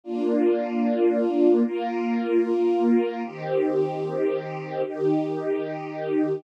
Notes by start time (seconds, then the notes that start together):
0.04 A#3 D4 F4
1.64 A#3 F4 A#4
3.23 D#3 C4 G4
4.84 D#3 D#4 G4